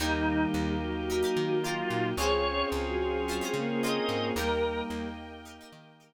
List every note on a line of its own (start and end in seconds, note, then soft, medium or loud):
0.00 0.46 D#2 loud
0.00 0.75 D#3 loud
0.00 0.75 G3 loud
0.00 2.13 A#3 medium
0.00 2.16 A#3 medium
0.00 0.43 D#4 medium
0.00 2.13 D#4 medium
0.00 2.16 D#4 medium
0.00 0.45 D#4 loud
0.00 2.13 G4 medium
0.00 2.16 G4 medium
0.00 0.43 G4 loud
0.00 0.43 A#4 medium
0.54 1.24 D#2 loud
0.81 1.60 F#3 loud
1.10 1.20 D#4 medium
1.10 1.20 G4 medium
1.10 1.20 A#4 medium
1.23 1.55 D#4 medium
1.23 1.55 G4 medium
1.23 1.55 A#4 medium
1.36 1.83 D#3 loud
1.64 2.11 F#3 loud
1.64 2.08 D#4 medium
1.64 2.08 F4 medium
1.64 2.08 G4 medium
1.64 2.08 A#4 medium
1.90 2.14 A#2 medium
2.17 2.64 C#2 loud
2.17 2.43 G#3 loud
2.17 4.34 C4 medium
2.17 4.32 C4 medium
2.17 4.34 C#4 medium
2.17 4.32 C#4 loud
2.17 2.62 C#4 medium
2.17 4.34 F4 medium
2.17 4.32 F4 medium
2.17 2.62 F4 medium
2.17 4.34 G#4 medium
2.17 4.32 G#4 medium
2.17 2.62 G#4 medium
2.17 2.67 C#5 loud
2.21 2.62 C5 medium
2.72 3.41 C#2 loud
2.87 3.26 F#3 loud
3.27 3.40 F#3 loud
3.27 3.39 C#4 medium
3.27 3.39 F4 medium
3.27 3.39 G#4 medium
3.32 3.39 C5 medium
3.41 3.54 G#3 loud
3.41 3.74 C#4 medium
3.41 3.74 F4 medium
3.41 3.74 G#4 medium
3.41 3.74 C5 medium
3.54 4.00 C#3 loud
3.54 3.68 A#3 loud
3.68 4.35 A#3 loud
3.83 4.27 C#4 medium
3.83 4.27 F4 medium
3.83 4.27 G#4 medium
3.83 4.27 C5 medium
3.83 4.27 D#5 medium
4.09 4.32 G#2 medium
4.36 4.82 D#2 loud
4.36 5.07 G3 loud
4.36 6.13 A#3 medium
4.36 5.07 A#3 loud
4.36 6.13 D#4 medium
4.36 4.80 D#4 medium
4.36 6.13 G4 medium
4.36 4.80 G4 medium
4.36 6.13 A#4 medium
4.36 4.82 A#4 medium
4.36 4.80 A#4 medium
4.36 6.13 D#5 medium
4.36 6.13 G5 medium
4.90 5.60 D#2 loud
5.45 5.56 D#4 medium
5.45 5.56 G4 medium
5.45 5.56 A#4 medium
5.61 5.94 D#4 medium
5.61 5.94 G4 medium
5.61 5.94 A#4 medium
5.73 6.13 D#3 loud
6.00 6.13 D#4 medium
6.00 6.13 G4 medium
6.00 6.13 A#4 medium